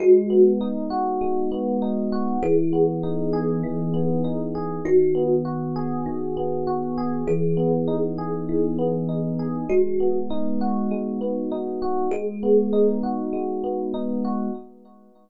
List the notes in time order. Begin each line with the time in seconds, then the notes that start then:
0.00 G#3 F#4
0.30 B3
0.61 D#4
0.90 F#4
1.21 G#3
1.52 B3
1.82 D#4
2.12 F#4
2.43 E3 G#4
2.73 B3
3.03 D#4
3.33 G#4
3.63 E3
3.94 B3
4.24 D#4
4.55 G#4
4.85 D#3 F#4
5.15 B3
5.45 F#4
5.76 G#4
6.06 D#3
6.37 B3
6.67 F#4
6.98 G#4
7.27 E3 G#4
7.57 B3
7.88 D#4
8.18 G#4
8.49 E3
8.79 B3
9.09 D#4
9.39 G#4
9.69 G#3 F#4
10.00 B3
10.30 D#4
10.61 F#4
10.91 G#3
11.21 B3
11.52 D#4
11.82 F#4
12.11 G#3 G#4
12.43 B3
12.73 D#4
13.03 F#4
13.33 G#3
13.64 B3
13.94 D#4
14.24 F#4